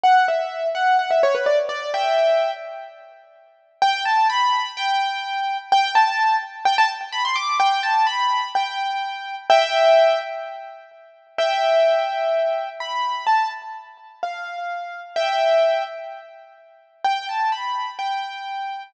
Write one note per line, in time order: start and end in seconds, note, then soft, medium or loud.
0.03 0.26 F#5 loud
0.28 0.68 E5 medium
0.75 0.97 F#5 loud
0.99 1.10 F#5 medium
1.11 1.22 E5 medium
1.23 1.34 C#5 loud
1.35 1.46 B4 medium
1.46 1.57 D5 loud
1.69 1.90 D5 loud
1.94 2.51 E5 loud
1.94 2.51 G5 loud
3.82 4.02 G5 loud
4.05 4.27 A5 loud
4.30 4.71 B5 loud
4.77 5.57 G5 loud
5.72 5.92 G5 loud
5.95 6.36 A5 loud
6.65 6.77 G5 loud
6.78 6.89 A5 loud
7.12 7.24 B5 loud
7.25 7.36 C6 loud
7.36 7.58 D6 loud
7.60 7.82 G5 loud
7.83 8.05 A5 loud
8.07 8.48 B5 loud
8.55 9.35 G5 loud
9.50 10.19 E5 loud
9.50 10.19 G5 loud
11.38 12.69 E5 loud
11.38 12.69 G5 loud
12.80 13.25 B5 loud
13.27 13.49 A5 loud
14.23 15.00 F5 medium
15.16 15.83 E5 loud
15.16 15.83 G5 loud
17.04 17.27 G5 loud
17.29 17.52 A5 medium
17.52 17.91 B5 medium
17.99 18.83 G5 medium